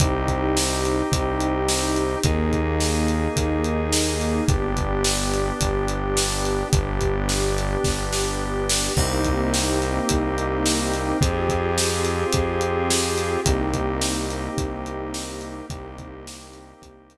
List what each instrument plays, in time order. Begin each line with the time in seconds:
0.00 synth bass 1 C2, drawbar organ C4 D#4 G4, pad 2 (warm) C4 D#4 G4, kick, closed hi-hat
0.28 kick, closed hi-hat
0.57 snare
0.85 closed hi-hat
1.12 synth bass 1 C2, kick, closed hi-hat
1.40 closed hi-hat
1.68 snare
1.96 closed hi-hat
2.23 synth bass 1 D#2, drawbar organ A#3 D#4 G#4, pad 2 (warm) A#3 D#4 G#4, kick, closed hi-hat
2.53 kick, closed hi-hat
2.80 snare
3.08 closed hi-hat
3.36 synth bass 1 D#2, kick, closed hi-hat
3.64 closed hi-hat
3.93 snare
4.21 closed hi-hat
4.47 synth bass 1 G1, pad 2 (warm) B3 D4 G4, drawbar organ B3 D4 G4, kick, closed hi-hat
4.77 kick, closed hi-hat
5.04 snare
5.34 closed hi-hat
5.61 synth bass 1 G1, kick, closed hi-hat
5.88 closed hi-hat
6.17 snare
6.45 closed hi-hat
6.73 synth bass 1 G1, drawbar organ B3 D4 G4, pad 2 (warm) B3 D4 G4, kick, closed hi-hat
7.01 kick, closed hi-hat
7.29 snare
7.58 closed hi-hat
7.84 synth bass 1 G1, kick, snare
8.13 snare
8.70 snare
8.96 synth bass 1 C2, pad 2 (warm) A#3 C4 D#4 G4, drawbar organ A#3 C4 D#4 G4, kick, crash
9.25 kick, closed hi-hat
9.54 snare
9.82 closed hi-hat
10.09 synth bass 1 C2, kick, closed hi-hat
10.38 closed hi-hat
10.66 snare
10.94 closed hi-hat
11.21 synth bass 1 F2, drawbar organ C4 F4 G4 G#4, pad 2 (warm) C4 F4 G4 G#4, kick, closed hi-hat
11.49 kick, closed hi-hat
11.78 snare
12.05 closed hi-hat
12.33 synth bass 1 F2, kick, closed hi-hat
12.61 closed hi-hat
12.90 snare
13.18 closed hi-hat
13.45 synth bass 1 C2, drawbar organ A#3 C4 D#4 G4, pad 2 (warm) A#3 C4 D#4 G4, kick, closed hi-hat
13.74 kick, closed hi-hat
14.01 snare
14.30 closed hi-hat
14.58 synth bass 1 C2, kick, closed hi-hat
14.86 closed hi-hat
15.14 snare
15.41 closed hi-hat
15.70 synth bass 1 C2, drawbar organ A#3 C4 D#4 G4, pad 2 (warm) A#3 C4 D#4 G4, kick, closed hi-hat
15.98 kick, closed hi-hat
16.27 snare
16.54 closed hi-hat
16.82 synth bass 1 C2, kick, closed hi-hat
17.10 closed hi-hat